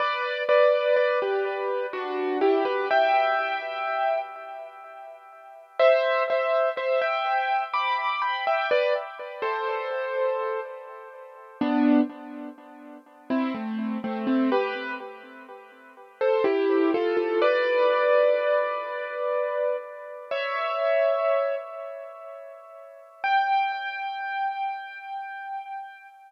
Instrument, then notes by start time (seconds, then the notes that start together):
acoustic grand piano
0.00 B4 D5
0.49 B4 D5
0.96 B4 D5
1.22 G4 B4
1.93 D4 F#4
2.41 E4 G4
2.65 G4 B4
2.91 E5 G5
5.79 C5 E5
6.30 C5 E5
6.77 C5 E5
7.01 E5 G5
7.74 B5 D6
8.22 G5 B5
8.47 E5 G5
8.71 B4 D5
9.42 A4 C5
11.61 B3 D4
13.30 C4 E4
13.54 A3 C4
14.04 A3 C4
14.27 A3 C4
14.52 G4 B4
16.21 A4 C5
16.44 E4 G4
16.94 F4 A4
17.17 F4 A4
17.42 B4 D5
20.31 C#5 E5
23.24 G5